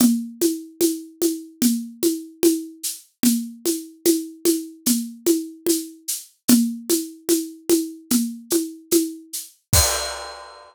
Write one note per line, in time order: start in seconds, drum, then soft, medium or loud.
0.00 low conga loud
0.00 shaker medium
0.41 high conga medium
0.41 shaker medium
0.81 high conga medium
0.81 shaker medium
1.22 high conga medium
1.22 shaker medium
1.62 low conga medium
1.62 shaker medium
2.03 high conga medium
2.03 shaker medium
2.43 high conga medium
2.43 shaker medium
2.83 shaker medium
3.23 low conga medium
3.23 shaker medium
3.66 high conga medium
3.66 shaker medium
4.05 high conga medium
4.05 shaker medium
4.45 high conga medium
4.45 shaker medium
4.86 low conga medium
4.86 shaker medium
5.26 high conga medium
5.26 shaker medium
5.66 high conga medium
5.66 shaker medium
6.08 shaker medium
6.48 low conga loud
6.48 shaker medium
6.90 high conga medium
6.90 shaker medium
7.29 high conga medium
7.29 shaker medium
7.69 high conga medium
7.69 shaker medium
8.10 low conga medium
8.10 shaker medium
8.50 high conga medium
8.50 shaker medium
8.91 high conga medium
8.91 shaker medium
9.33 shaker medium
9.73 kick loud
9.73 crash loud